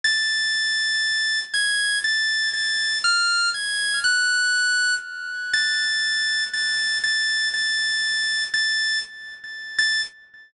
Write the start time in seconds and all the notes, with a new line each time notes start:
0.04 A6
1.54 G#6
2.04 A6
2.53 A6
3.04 F6
3.54 G#6
4.04 F#6
5.54 A6
6.53 A6
7.04 A6
7.54 A6
8.54 A6
9.79 A6